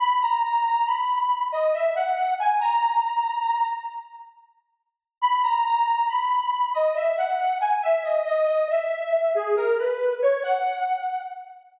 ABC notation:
X:1
M:3/4
L:1/16
Q:1/4=69
K:G#m
V:1 name="Lead 1 (square)"
b a a a b3 d e f2 g | a6 z6 | b a a a b3 d e f2 g | e d d d e3 G A B2 c |
f4 z8 |]